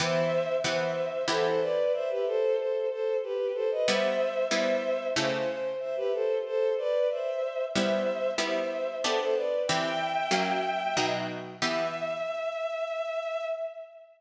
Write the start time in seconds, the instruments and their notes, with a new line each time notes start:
0.00 harpsichord E3 B3 G4, violin C5 E5
0.64 harpsichord E3 B3 G4, violin C5 E5
1.28 harpsichord E3 B3 G4, violin A4 C5
1.45 violin A4 C5
1.61 violin B4 D5
1.94 violin C5 E5
2.10 violin G4 B4
2.26 violin A4 C5
2.58 violin A4 C5
2.91 violin A4 C5
3.23 violin G4 B4
3.54 violin A4 C5
3.71 violin B4 D#5
3.87 harpsichord G3 B3 E4, violin C5 E5
4.51 harpsichord G3 B3 E4, violin C5 E5
5.16 harpsichord C#3 A3 E4 G4, violin C5
5.33 violin C5
5.49 violin C5
5.80 violin C5 E5
5.96 violin G4 B4
6.13 violin A4 C5
6.46 violin A4 C5
6.78 violin B4 D5
7.11 violin C5 E5
7.74 harpsichord G3 B3 E4, violin C5 E5
8.38 harpsichord G3 B3 E4, violin C5 E5
9.03 harpsichord B3 D4 G4, violin A4 C5
9.19 violin A4 C5
9.35 violin B4 D5
9.67 harpsichord E3 C4 G4, violin E5 G5
10.31 harpsichord F#3 A#3 C#4
10.97 harpsichord B2 F#3 D#4
11.61 harpsichord E3 B3 G4, violin E5